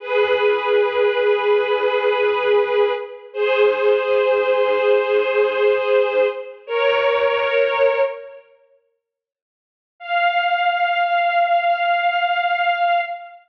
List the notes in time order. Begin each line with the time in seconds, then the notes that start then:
0.00 G#4 B4
3.33 G#4 C5
6.67 A#4 C#5
10.00 F5